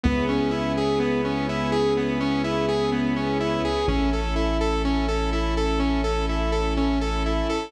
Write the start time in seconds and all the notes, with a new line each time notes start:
0.04 C#2 B3 C#4 E4 G#4
0.29 C#4
0.51 E4
0.77 G#4
1.00 B3
1.25 C#4
1.49 E4
1.72 G#4
1.97 B3
2.20 C#4
2.44 E4
2.69 G#4
2.92 B3
3.16 C#4
3.40 E4
3.65 G#4
3.88 A1 C#4 E4 A4
4.13 A4
4.36 E4
4.61 A4
4.85 C#4
5.08 A4
5.33 E4
5.57 A4
5.80 C#4
6.04 A4
6.29 E4
6.52 A4
6.77 C#4
7.01 A4
7.26 E4
7.49 A4